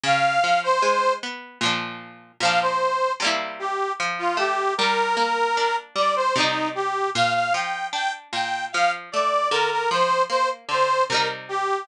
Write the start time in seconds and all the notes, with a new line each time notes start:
0.04 C#3 F5
0.44 F3
0.63 C5
0.82 G#3
1.23 B3
1.61 A#2 F3
1.65 D4
2.40 A#2 F3 F5
2.45 D4
2.61 C5
3.20 C3 G3
3.25 A#3 E4
3.59 G4
4.00 F3
4.19 F4
4.37 A3 G4
4.78 G3 A#4
5.17 A#3
5.57 D4
5.96 G3 D5
6.16 C5
6.36 C3 G3 D#4
6.40 D#4
6.75 G4
7.15 A#2 F5
7.34 F5
7.54 F3 G5
7.93 D4 G5
8.33 A#2 G5
8.73 F3 F5
9.12 A3 D5
9.51 D3 A#4
9.71 A#4
9.91 F3 C5
10.30 A#3 C5
10.69 D3 C5
11.09 C3 G3 A#4
11.14 D#4
11.49 G4